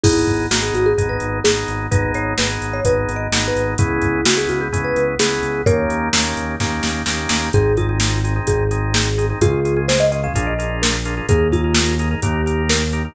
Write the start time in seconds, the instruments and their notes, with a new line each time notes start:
0.04 synth bass 1 G#1, drawbar organ B3 D#4 G#4, marimba E4 G#4, kick, crash
0.27 synth bass 1 G#1, kick, closed hi-hat
0.51 synth bass 1 G#1, drawbar organ B3 D#4 G#4, marimba F#4, snare
0.62 marimba G#4
0.74 synth bass 1 G#1, marimba F#4, closed hi-hat
0.86 marimba G#4
0.98 synth bass 1 G#1, drawbar organ B3 D#4 G#4, kick, closed hi-hat
1.09 marimba B4
1.20 synth bass 1 G#1, closed hi-hat
1.44 synth bass 1 G#1, drawbar organ B3 D#4 G#4, marimba G#4, snare
1.68 synth bass 1 G#1, closed hi-hat
1.91 synth bass 1 G#1, drawbar organ B3 D#4 G#4, marimba B4, kick, closed hi-hat
2.14 synth bass 1 G#1, marimba C#5, closed hi-hat
2.38 synth bass 1 G#1, drawbar organ B3 D#4 G#4, marimba B4, snare
2.62 synth bass 1 G#1, closed hi-hat
2.73 marimba C#5
2.85 synth bass 1 G#1, drawbar organ B3 D#4 G#4, marimba B4, kick, closed hi-hat
3.08 synth bass 1 G#1, closed hi-hat
3.16 marimba D#5
3.32 synth bass 1 G#1, drawbar organ B3 D#4 G#4, snare
3.48 marimba B4
3.56 synth bass 1 G#1, closed hi-hat
3.78 synth bass 1 C#2, drawbar organ B3 C#4 E4 G#4, marimba E4 G#4, kick, closed hi-hat
4.02 synth bass 1 C#2, kick, closed hi-hat
4.25 synth bass 1 C#2, drawbar organ B3 C#4 E4 G#4, marimba F#4, snare
4.37 marimba G#4
4.49 synth bass 1 C#2, marimba F#4, closed hi-hat
4.61 marimba G#4
4.72 synth bass 1 C#2, drawbar organ B3 C#4 E4 G#4, kick, closed hi-hat
4.84 marimba B4
4.96 synth bass 1 C#2, closed hi-hat
5.19 synth bass 1 C#2, drawbar organ B3 C#4 E4 G#4, marimba G#4, snare
5.43 synth bass 1 C#2, closed hi-hat
5.66 synth bass 1 D#2, drawbar organ A#3 C#4 D#4 G4, marimba A#4 C#5, kick, closed hi-hat
5.90 synth bass 1 D#2, closed hi-hat
6.13 synth bass 1 D#2, drawbar organ A#3 C#4 D#4 G4, snare
6.37 synth bass 1 D#2, closed hi-hat
6.60 synth bass 1 D#2, drawbar organ A#3 C#4 D#4 G4, kick, snare
6.83 synth bass 1 D#2, snare
7.06 synth bass 1 D#2, drawbar organ A#3 C#4 D#4 G4, snare
7.29 synth bass 1 D#2, snare
7.53 synth bass 1 G#1, drawbar organ C4 D#4 G#4, marimba G#4, kick, closed hi-hat
7.77 drawbar organ C4 D#4 G#4, marimba F4, kick, closed hi-hat
7.89 drawbar organ C4 D#4 G#4
8.00 drawbar organ C4 D#4 G#4, snare
8.24 drawbar organ C4 D#4 G#4, closed hi-hat
8.36 drawbar organ C4 D#4 G#4
8.47 synth bass 1 G#1, marimba G#4, kick, closed hi-hat
8.71 drawbar organ C4 D#4 G#4, closed hi-hat
8.94 marimba G#4, snare
9.18 drawbar organ C4 D#4 G#4, closed hi-hat
9.30 drawbar organ C4 D#4 G#4
9.41 synth bass 1 C#2, drawbar organ C#4 F4 G#4, marimba F4 G#4, kick, closed hi-hat
9.65 drawbar organ C#4 F4 G#4, closed hi-hat
9.76 drawbar organ C#4 F4 G#4
9.88 drawbar organ C#4 F4 G#4, marimba C5, snare
10.00 marimba D#5
10.12 drawbar organ C#4 F4 G#4, marimba D#5, closed hi-hat
10.23 drawbar organ C#4 F4 G#4, marimba F5
10.34 synth bass 1 A#1, drawbar organ D4 F4 G#4 A#4, kick, closed hi-hat
10.47 marimba D#5
10.58 drawbar organ D4 F4 G#4 A#4, closed hi-hat
10.82 marimba A#4, snare
11.05 drawbar organ D4 F4 G#4 A#4, closed hi-hat
11.17 drawbar organ D4 F4 G#4 A#4
11.29 synth bass 1 D#2, drawbar organ D#4 G#4 A#4, marimba G#4, kick, closed hi-hat
11.52 drawbar organ D#4 G#4 A#4, marimba F4, kick, closed hi-hat
11.64 drawbar organ D#4 G#4 A#4
11.75 drawbar organ D#4 G#4 A#4, snare
11.99 drawbar organ D#4 G#4 A#4, closed hi-hat
12.11 drawbar organ D#4 G#4 A#4
12.22 synth bass 1 D#2, drawbar organ D#4 G4 A#4, marimba G4, kick, closed hi-hat
12.46 drawbar organ D#4 G4 A#4, closed hi-hat
12.69 marimba A#4, snare
12.92 drawbar organ D#4 G4 A#4, closed hi-hat
13.05 drawbar organ D#4 G4 A#4